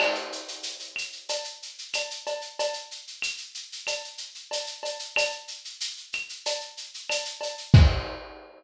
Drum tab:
CC |x---------------|----------------|----------------|x---------------|
SH |-xxxxxxxxxxxxxxx|xxxxxxxxxxxxxxxx|xxxxxxxxxxxxxxxx|----------------|
CB |x-------x---x-x-|x-------x---x-x-|x-------x---x-x-|----------------|
CL |x-----x-----x---|----x---x-------|x-----x-----x---|----------------|
BD |----------------|----------------|----------------|o---------------|